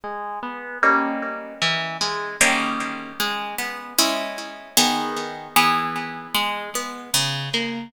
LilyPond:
\new Staff { \time 2/4 \key gis \minor \tempo 4 = 76 gis8 b8 <g ais cis' dis'>4 | e8 gis8 <dis g ais cis'>4 | gis8 b8 <gis cis' e'>4 | <dis b gis'>4 <e b gis'>4 |
gis8 b8 cis8 ais8 | }